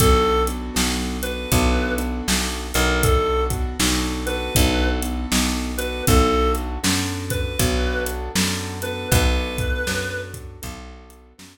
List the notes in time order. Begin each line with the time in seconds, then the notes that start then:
0.00 B1 B3 D4 F#4 A4, kick, closed hi-hat
0.47 B3 D4 F#4 A4, closed hi-hat
0.74 B1 B3 D4 F#4 A4, snare
1.22 B3 D4 F#4 A4 B4, closed hi-hat
1.52 B1 B3 D4 F#4 A4, kick, closed hi-hat
1.98 B3 D4 F#4 A4, closed hi-hat
2.28 B1, snare
2.74 B1 B3 D4 F#4 A4 A#4, closed hi-hat
3.03 B3 D4 F#4 A4, kick, closed hi-hat
3.50 B3 D4 F#4 A4, kick, closed hi-hat
3.79 B1 B3 D4 F#4 A4, snare
4.26 B3 D4 F#4 A4 B4, closed hi-hat
4.55 B1 B3 D4 F#4 A4, kick, closed hi-hat
5.02 B3 D4 F#4 A4, closed hi-hat
5.32 B1, snare
5.78 B3 D4 F#4 A4 B4, closed hi-hat
6.07 B1 B3 D4 F#4 A4, kick, closed hi-hat
6.55 closed hi-hat
6.83 F#2 B3 D4 F#4 A4, snare
7.30 B4, kick, closed hi-hat
7.59 B1 B3 D4 F#4 A4, kick, closed hi-hat
8.06 closed hi-hat
8.35 F#2 B3 D4 F#4 A4, snare
8.82 B3 D4 F#4 A4 B4, closed hi-hat
9.12 B1 B3 D4 F#4 A4 B4, kick, closed hi-hat
9.58 kick, closed hi-hat
9.87 F#2 B3 D4 F#4 A4, snare
10.34 kick, closed hi-hat
10.62 B1 B3 D4 F#4 A4, kick, closed hi-hat
11.10 closed hi-hat
11.38 F#2 B3 D4 F#4 A4, snare